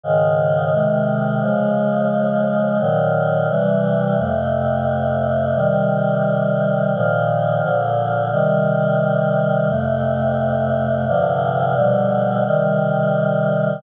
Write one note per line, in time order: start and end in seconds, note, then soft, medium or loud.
0.03 0.72 G#2 medium
0.03 0.72 C#3 medium
0.03 0.72 D#3 medium
0.73 1.41 C3 medium
0.73 1.41 D#3 medium
0.73 1.41 G#3 medium
1.42 2.78 C#3 medium
1.42 2.78 F3 medium
1.42 2.78 G#3 medium
2.79 3.48 A#2 medium
2.79 3.48 D#3 medium
2.79 3.48 F#3 medium
3.49 4.17 C3 medium
3.49 4.17 E3 medium
3.49 4.17 G3 medium
4.18 5.54 F2 medium
4.18 5.54 C3 medium
4.18 5.54 A3 medium
5.55 6.92 C3 medium
5.55 6.92 D#3 medium
5.55 6.92 G3 medium
6.94 7.61 A#2 medium
6.94 7.63 D#3 medium
6.94 7.61 F3 medium
7.62 8.30 A#2 medium
7.62 8.30 D3 medium
7.62 8.30 F3 medium
8.32 9.68 C3 medium
8.32 9.68 D#3 medium
8.32 9.68 G3 medium
9.69 11.05 F2 medium
9.69 11.05 C3 medium
9.69 11.05 A3 medium
11.08 11.76 G2 medium
11.08 11.76 C3 medium
11.08 11.75 D3 medium
11.08 11.75 F3 medium
11.75 12.44 B2 medium
11.75 12.44 D3 medium
11.75 12.44 F3 medium
11.75 12.44 G3 medium
12.45 13.81 C3 medium
12.45 13.81 D#3 medium
12.45 13.81 G3 medium